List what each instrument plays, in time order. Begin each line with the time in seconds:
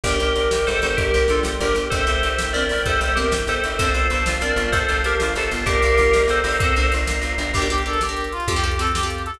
0.04 electric bass (finger) G1, orchestral harp D4, tubular bells G4 A#4, choir aahs A#4 D5 G5, kick, crash
0.20 electric bass (finger) G1, orchestral harp G4, closed hi-hat
0.35 electric bass (finger) G1, orchestral harp A#4, closed hi-hat
0.51 electric bass (finger) G1, orchestral harp G4, snare
0.67 electric bass (finger) G1, orchestral harp D4, tubular bells A4 C5, closed hi-hat
0.82 electric bass (finger) G1, orchestral harp G4, closed hi-hat
0.97 electric bass (finger) G1, tubular bells G4 A#4, orchestral harp A#4, kick, closed hi-hat
1.14 electric bass (finger) G1, orchestral harp G4, closed hi-hat
1.28 electric bass (finger) G1, orchestral harp D4, tubular bells F4 A4, closed hi-hat
1.43 electric bass (finger) G1, orchestral harp G4, snare
1.60 electric bass (finger) G1, tubular bells G4 A#4, orchestral harp A#4, closed hi-hat
1.75 electric bass (finger) G1, orchestral harp G4, closed hi-hat
1.90 electric bass (finger) G1, orchestral harp C4, tubular bells A4 C5, choir aahs C5 E5 G5, kick, closed hi-hat
2.07 electric bass (finger) G1, orchestral harp E4, closed hi-hat
2.23 electric bass (finger) G1, orchestral harp G4, closed hi-hat
2.38 electric bass (finger) G1, orchestral harp E4, snare
2.53 electric bass (finger) G1, orchestral harp C4, tubular bells A#4 D5, closed hi-hat
2.69 electric bass (finger) G1, orchestral harp E4, open hi-hat
2.86 electric bass (finger) G1, orchestral harp G4, tubular bells A4 C5, kick, closed hi-hat
3.01 electric bass (finger) G1, orchestral harp E4, closed hi-hat
3.15 electric bass (finger) G1, orchestral harp C4, tubular bells G4 A#4, closed hi-hat
3.31 electric bass (finger) G1, orchestral harp E4, snare
3.47 electric bass (finger) G1, orchestral harp G4, tubular bells A4 C5, closed hi-hat
3.64 electric bass (finger) G1, orchestral harp E4, closed hi-hat
3.78 electric bass (finger) G1, orchestral harp C4, tubular bells A4 C5, choir aahs C5 F5 A5, kick, closed hi-hat
3.94 electric bass (finger) G1, orchestral harp F4, closed hi-hat
4.10 electric bass (finger) G1, orchestral harp A4, closed hi-hat
4.26 electric bass (finger) G1, orchestral harp F4, snare
4.40 electric bass (finger) G1, orchestral harp C4, tubular bells A#4 D5, closed hi-hat
4.56 electric bass (finger) G1, orchestral harp F4, closed hi-hat
4.72 electric bass (finger) G1, tubular bells A4 C5, orchestral harp A4, kick, closed hi-hat
4.89 electric bass (finger) G1, orchestral harp F4, closed hi-hat
5.04 electric bass (finger) G1, orchestral harp C4, tubular bells G4 A#4, closed hi-hat
5.20 electric bass (finger) G1, orchestral harp F4, snare
5.35 electric bass (finger) G1, orchestral harp A4, tubular bells A4 C5, closed hi-hat
5.51 electric bass (finger) G1, orchestral harp F4, closed hi-hat
5.66 electric bass (finger) G1, orchestral harp C4, tubular bells G4 A#4, choir aahs C5 D5 F5 A#5, kick, closed hi-hat
5.82 electric bass (finger) G1, orchestral harp D4, closed hi-hat
5.97 electric bass (finger) G1, orchestral harp F4, closed hi-hat
6.13 electric bass (finger) G1, orchestral harp A#4, snare
6.28 electric bass (finger) G1, orchestral harp F4, tubular bells A4 C5, closed hi-hat
6.44 electric bass (finger) G1, orchestral harp D4, open hi-hat
6.60 electric bass (finger) G1, orchestral harp C4, tubular bells A4 C5, kick, closed hi-hat
6.76 electric bass (finger) G1, orchestral harp D4, closed hi-hat
6.92 electric bass (finger) G1, orchestral harp F4, closed hi-hat
7.07 electric bass (finger) G1, orchestral harp A#4, snare
7.22 electric bass (finger) G1, orchestral harp F4, closed hi-hat
7.38 electric bass (finger) G1, orchestral harp D4, closed hi-hat
7.54 electric bass (finger) G1, orchestral harp D4 G4 A#4, brass section G4, kick, crash
7.62 orchestral harp D4 G4 A#4, closed hi-hat
7.70 orchestral harp D4 G4 A#4, brass section G4, closed hi-hat
7.78 closed hi-hat
7.86 orchestral harp D4 G4 A#4, brass section A4, closed hi-hat
7.93 closed hi-hat
8.01 orchestral harp D4 G4 A#4, brass section G4, snare
8.09 orchestral harp D4 G4 A#4, closed hi-hat
8.17 closed hi-hat
8.24 closed hi-hat
8.32 brass section F4, closed hi-hat
8.40 closed hi-hat
8.48 electric bass (finger) F2, orchestral harp C4 F4 G4 A4, brass section G4, kick, closed hi-hat
8.56 orchestral harp C4 F4 G4 A4, closed hi-hat
8.63 orchestral harp C4 F4 G4 A4, brass section G4, closed hi-hat
8.71 closed hi-hat
8.79 orchestral harp C4 F4 G4 A4, brass section A4, closed hi-hat
8.87 closed hi-hat
8.94 orchestral harp C4 F4 G4 A4, brass section G4, snare
9.03 orchestral harp C4 F4 G4 A4, closed hi-hat
9.10 closed hi-hat
9.18 closed hi-hat
9.26 brass section A4, closed hi-hat
9.34 closed hi-hat